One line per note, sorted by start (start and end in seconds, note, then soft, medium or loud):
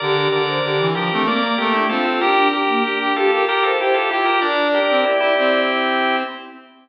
0.00 0.27 D3 medium
0.00 0.15 G4 loud
0.00 0.29 A#4 medium
0.00 0.29 D5 medium
0.16 0.42 G4 medium
0.32 0.59 D3 medium
0.32 0.87 A#4 medium
0.32 0.87 D5 medium
0.47 0.62 C5 medium
0.63 0.78 D3 medium
0.63 0.89 G4 medium
0.79 0.94 E3 medium
0.95 1.10 F3 medium
0.95 1.10 D4 medium
0.95 1.22 G4 medium
0.95 1.22 A#4 medium
1.10 1.27 A3 medium
1.10 1.25 C4 medium
1.25 1.55 A#3 medium
1.25 1.41 C4 medium
1.25 1.42 A#4 medium
1.25 1.42 D5 medium
1.42 1.57 A#3 medium
1.42 1.57 A#4 medium
1.42 1.57 D5 medium
1.58 1.84 A3 medium
1.58 1.73 A#3 medium
1.58 1.73 G4 medium
1.58 1.73 A#4 medium
1.73 1.89 D4 medium
1.73 1.88 E4 medium
1.73 1.88 G4 medium
1.89 2.20 C4 medium
1.89 2.04 F4 medium
1.89 2.04 A4 medium
2.05 2.20 F4 medium
2.05 2.20 A4 medium
2.20 2.36 D4 loud
2.20 2.48 G4 loud
2.20 2.49 G4 medium
2.20 2.49 A#4 medium
2.37 2.63 D4 medium
2.53 3.12 G4 medium
2.53 2.83 G4 medium
2.53 3.12 A#4 medium
2.68 2.83 A#3 medium
2.84 3.13 D4 medium
2.84 2.99 G4 medium
3.01 3.15 G4 medium
3.16 3.42 F4 medium
3.16 3.31 G4 loud
3.16 3.31 G4 medium
3.16 3.42 A4 medium
3.31 3.45 G4 medium
3.31 3.46 A#4 medium
3.45 3.71 G4 medium
3.45 3.64 G4 medium
3.45 3.62 A#4 medium
3.45 3.64 A#4 medium
3.63 3.78 F4 medium
3.63 3.78 A4 medium
3.63 3.78 C5 medium
3.79 3.95 E4 medium
3.79 4.10 G4 medium
3.79 3.95 G4 medium
3.79 3.94 C5 loud
3.94 4.09 F4 medium
3.94 4.10 G4 medium
3.94 4.09 A4 medium
4.10 4.26 E4 medium
4.10 4.25 F4 medium
4.10 4.25 G4 medium
4.10 4.38 G4 medium
4.25 4.41 F4 medium
4.25 4.40 G4 medium
4.25 4.40 A#4 medium
4.41 4.79 D4 loud
4.41 4.68 A#4 medium
4.41 4.68 D5 medium
4.41 5.60 D5 loud
4.74 5.04 G4 medium
4.74 5.04 A#4 medium
4.90 5.05 C4 medium
5.05 5.20 E4 medium
5.05 5.20 G4 medium
5.19 5.34 E4 medium
5.19 6.16 E4 medium
5.19 6.16 G4 medium
5.37 6.23 C4 medium